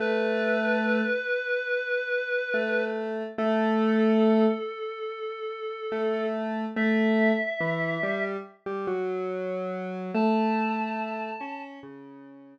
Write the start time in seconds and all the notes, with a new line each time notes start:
0.00 A3 B4
2.54 A3
3.38 A3 A4
5.92 A3
6.76 A3 E5
7.60 E3
8.03 G3
8.66 G3
8.87 F#3
10.14 A3 A5
11.40 C#4
11.83 C#3